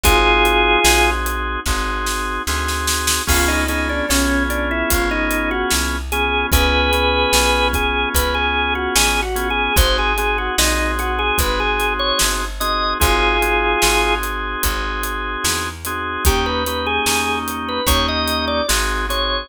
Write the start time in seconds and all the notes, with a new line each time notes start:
0.04 G#1 C4 D#4 F4 F#4 G#4, kick, closed hi-hat
0.45 closed hi-hat
0.84 A#1 C4 D#4 F#4 G#4, snare
1.26 closed hi-hat
1.66 G#1 C4 D#4 F#4 G#4, kick, snare
2.06 snare
2.47 D2 C4 D#4 F#4 G#4, snare
2.68 snare
2.87 snare
3.07 snare
3.27 C#2 B3 C#4 F4 G#4, kick, crash
3.48 D#4
3.68 B3 C#4 D#4 F4 G#4, closed hi-hat
3.89 D4
4.09 B1 B3 C#4 F4 G#4, snare
4.50 D4, closed hi-hat
4.71 E4
4.90 G#1 F4, kick, closed hi-hat
5.11 D#4
5.31 closed hi-hat
5.51 F#4
5.70 C2, snare
6.12 B3 C#4 F4 G#4, closed hi-hat
6.52 C#2 B3 C#4 F4 G#4 B4, kick, closed hi-hat
6.93 B3 C#4 F4 G#4, closed hi-hat
7.33 B1 B3 C#4 F4 G#4, snare
7.73 G#4, kick, closed hi-hat
8.14 C#2 B4, kick, closed hi-hat
8.34 G#4
8.75 F#4
8.95 A1 G#4, snare
9.22 F#4
9.35 B3 C#4 F4 G#4, closed hi-hat
9.50 G#4
9.76 G#1 C4 D#4 F#4 G#4 C5, kick, closed hi-hat
9.98 G#4
10.18 C4 D#4 F#4 G#4, closed hi-hat
10.38 F#4
10.58 A#1 C4 D#4 F#4 G#4, snare
10.99 F#4, closed hi-hat
11.19 G#4
11.38 G#1 B4, kick, closed hi-hat
11.60 G#4
11.80 closed hi-hat
11.99 C#5
12.19 G1, snare
12.60 C4 D#4 F#4 G#4 D#5, closed hi-hat
13.00 G#1 C4 D#4 F4 F#4 G#4, kick, closed hi-hat
13.42 C4 D#4 F#4 G#4, closed hi-hat
13.82 G#1 C4 D#4 F#4 G#4, snare
14.23 closed hi-hat
14.63 G#1, kick, closed hi-hat
15.03 closed hi-hat
15.44 E2, snare
15.85 C4 D#4 F#4 G#4, closed hi-hat
16.25 D#2 A#3 C#4 D#4 G4, kick, closed hi-hat
16.46 B4
16.66 A#3 C#4 D#4 G4 B4, closed hi-hat
16.86 G#4
17.06 E2 A#3 C#4 D#4 G4 G#4, snare
17.48 closed hi-hat
17.69 B4
17.86 D#2 A#3 C#4 D#4 G4 C#5, kick, closed hi-hat
18.08 D#5
18.28 closed hi-hat
18.48 D5
18.68 G#1 C4 D#4 F#4 G#4, snare
19.09 C4 D#4 F#4 G#4 C#5, closed hi-hat